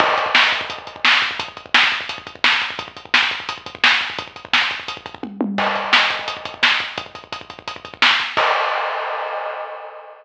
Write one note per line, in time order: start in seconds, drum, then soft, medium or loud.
0.00 kick medium
0.00 crash medium
0.09 kick medium
0.18 kick medium
0.18 closed hi-hat medium
0.26 kick medium
0.35 kick medium
0.35 snare loud
0.44 kick medium
0.52 kick medium
0.52 closed hi-hat medium
0.61 kick medium
0.70 kick medium
0.70 closed hi-hat medium
0.78 kick medium
0.87 kick medium
0.87 closed hi-hat medium
0.96 kick medium
1.05 kick medium
1.05 snare loud
1.13 kick medium
1.22 kick medium
1.22 closed hi-hat medium
1.31 kick medium
1.40 kick loud
1.40 closed hi-hat loud
1.48 kick medium
1.57 kick medium
1.57 closed hi-hat medium
1.66 kick medium
1.74 kick medium
1.74 snare loud
1.83 kick medium
1.92 kick medium
1.92 closed hi-hat medium
2.01 kick medium
2.09 kick medium
2.09 closed hi-hat loud
2.18 kick medium
2.27 kick medium
2.27 closed hi-hat medium
2.35 kick medium
2.44 kick medium
2.44 snare loud
2.53 kick medium
2.61 kick medium
2.61 closed hi-hat medium
2.70 kick medium
2.79 kick loud
2.79 closed hi-hat medium
2.88 kick medium
2.97 kick medium
2.97 closed hi-hat medium
3.05 kick medium
3.14 kick medium
3.14 snare medium
3.23 kick medium
3.31 kick medium
3.31 closed hi-hat medium
3.40 kick medium
3.49 kick medium
3.49 closed hi-hat loud
3.58 kick medium
3.66 kick medium
3.66 closed hi-hat medium
3.75 kick medium
3.84 kick medium
3.84 snare loud
3.92 kick medium
4.01 kick medium
4.01 closed hi-hat medium
4.10 kick medium
4.18 kick loud
4.18 closed hi-hat medium
4.28 kick medium
4.36 kick medium
4.36 closed hi-hat medium
4.45 kick medium
4.53 kick medium
4.53 snare medium
4.62 kick medium
4.71 kick medium
4.71 closed hi-hat medium
4.80 kick medium
4.88 kick medium
4.88 closed hi-hat loud
4.97 kick medium
5.06 kick medium
5.06 closed hi-hat medium
5.15 kick medium
5.23 kick medium
5.23 high tom medium
5.41 high tom loud
5.58 kick loud
5.58 crash loud
5.67 kick medium
5.75 kick medium
5.75 closed hi-hat medium
5.84 kick medium
5.93 kick medium
5.93 snare loud
6.02 kick medium
6.10 kick medium
6.10 closed hi-hat medium
6.19 kick medium
6.28 kick medium
6.28 closed hi-hat loud
6.37 kick medium
6.45 kick medium
6.45 closed hi-hat medium
6.54 kick medium
6.63 kick medium
6.63 snare medium
6.72 kick medium
6.80 kick medium
6.80 closed hi-hat medium
6.98 kick loud
6.98 closed hi-hat medium
7.06 kick medium
7.15 kick medium
7.15 closed hi-hat medium
7.24 kick medium
7.32 kick medium
7.32 closed hi-hat medium
7.41 kick medium
7.50 kick medium
7.50 closed hi-hat medium
7.59 kick medium
7.68 kick medium
7.68 closed hi-hat medium
7.76 kick medium
7.85 kick medium
7.85 closed hi-hat medium
7.94 kick medium
8.02 kick medium
8.02 snare loud
8.11 kick medium
8.20 kick medium
8.20 closed hi-hat medium
8.37 kick loud
8.37 crash loud